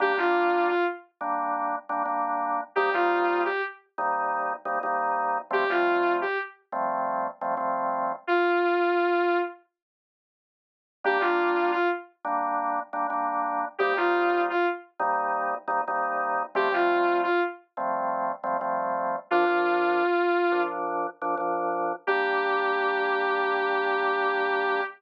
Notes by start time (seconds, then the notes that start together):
0.00 G3 A#3 D4 G4
0.17 G3 A#3 D4 F4
0.67 F4
1.21 G3 A#3 D4
1.89 G3 A#3 D4
2.05 G3 A#3 D4
2.75 C3 G3 A#3 D#4 G4
2.94 C3 G3 A#3 D#4 F4
3.45 G4
3.98 C3 G3 A#3 D#4
4.65 C3 G3 A#3 D#4
4.83 C3 G3 A#3 D#4
5.51 F3 G3 A3 C4 G4
5.70 F3 G3 A3 C4 F4
6.21 G4
6.72 F3 G3 A3 C4
7.41 F3 G3 A3 C4
7.57 F3 G3 A3 C4
8.27 F4
11.04 G3 A#3 D4 G4
11.20 G3 A#3 D4 F4
11.71 F4
12.25 G3 A#3 D4
12.93 G3 A#3 D4
13.10 G3 A#3 D4
13.78 C3 G3 A#3 D#4 G4
13.97 C3 G3 A#3 D#4 F4
14.49 F4
15.00 C3 G3 A#3 D#4
15.68 C3 G3 A#3 D#4
15.88 C3 G3 A#3 D#4
16.55 F3 G3 A3 C4 G4
16.72 F3 G3 A3 C4 F4
17.23 F4
17.77 F3 G3 A3 C4
18.44 F3 G3 A3 C4
18.61 F3 G3 A3 C4
19.30 A#2 F3 D4 F4
19.48 A#2 F3 D4
20.52 A#2 F3 D4
21.22 A#2 F3 D4
21.37 A#2 F3 D4
22.07 G3 A#3 D4 G4